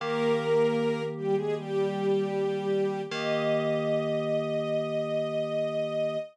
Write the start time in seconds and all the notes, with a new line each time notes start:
0.00 D#3 A#3 G4 A#4
1.17 G3 G4
1.36 G#3 G#4
1.56 G3 G4
3.11 D#3 A#3 G4 D#5